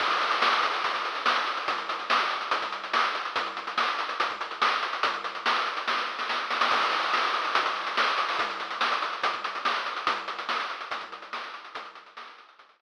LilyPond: \new DrumStaff \drummode { \time 4/4 \tempo 4 = 143 <cymc bd>16 hh16 hh16 hh16 sn16 hh16 hh16 hh16 <hh bd>16 <hh bd>16 hh16 hh16 sn16 hh16 hh16 hh16 | <hh bd>16 hh16 hh16 hh16 sn16 hh16 hh16 hh16 <hh bd>16 <hh bd>16 hh16 hh16 sn16 hh16 hh16 hh16 | <hh bd>16 hh16 hh16 hh16 sn16 hh16 hh16 hh16 <hh bd>16 <hh bd>16 hh16 hh16 sn16 hh16 hh16 hh16 | <hh bd>16 hh16 hh16 hh16 sn16 hh16 hh16 hh16 <bd sn>16 sn8 sn16 sn8 sn16 sn16 |
<cymc bd>16 hh16 hh16 hh16 sn16 hh16 hh16 hh16 <hh bd>16 <hh bd>16 hh16 hh16 sn16 hh16 hh16 hho16 | <hh bd>16 hh16 hh16 hh16 sn16 hh16 hh16 hh16 <hh bd>16 <hh bd>16 hh16 hh16 sn16 hh16 hh16 hh16 | <hh bd>16 hh16 hh16 hh16 sn16 hh16 hh16 hh16 <hh bd>16 <hh bd>16 hh16 hh16 sn16 hh16 hh16 hh16 | <hh bd>16 hh16 hh16 hh16 sn16 hh16 hh16 hh16 <hh bd>16 <hh bd>16 hh8 r4 | }